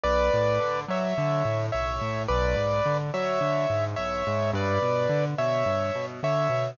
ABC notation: X:1
M:4/4
L:1/8
Q:1/4=107
K:Bm
V:1 name="Acoustic Grand Piano"
[Bd]3 [ce]3 [ce]2 | [Bd]3 [ce]3 [ce]2 | [Bd]3 [ce]3 [ce]2 |]
V:2 name="Acoustic Grand Piano" clef=bass
B,,, A,, D, F, D, A,, B,,, A,, | B,,, ^G,, D, F, D, G,, B,,, G,, | G,, B,, D, B,, G,, B,, D, B,, |]